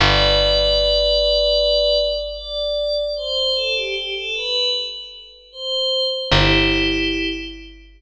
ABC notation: X:1
M:4/4
L:1/16
Q:1/4=76
K:G
V:1 name="Pad 5 (bowed)"
[Bd]12 d4 | c2 A G G A B2 z4 c3 z | [EG]6 z10 |]
V:2 name="Electric Bass (finger)" clef=bass
G,,,16- | G,,,16 | G,,,16 |]